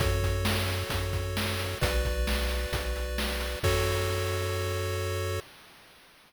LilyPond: <<
  \new Staff \with { instrumentName = "Lead 1 (square)" } { \time 4/4 \key fis \minor \tempo 4 = 132 <fis' a' cis''>1 | <fis' b' d''>1 | <fis' a' cis''>1 | }
  \new Staff \with { instrumentName = "Synth Bass 1" } { \clef bass \time 4/4 \key fis \minor fis,2 fis,2 | b,,2 b,,2 | fis,1 | }
  \new DrumStaff \with { instrumentName = "Drums" } \drummode { \time 4/4 <hh bd>8 <hh bd>8 sn8 hh8 <hh bd>8 <hh bd>8 sn8 hh8 | <hh bd>8 <hh bd>8 sn8 hh8 <hh bd>8 hh8 sn8 hh8 | <cymc bd>4 r4 r4 r4 | }
>>